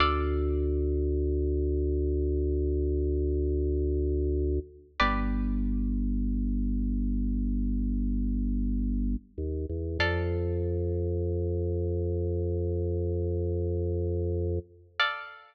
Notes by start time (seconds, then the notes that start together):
0.00 D2 A4 D5 F5
5.00 G1 G4 B4 D5
9.38 D#2
9.70 E2
9.99 F2 A4 D5 F5
14.99 A4 D5 F5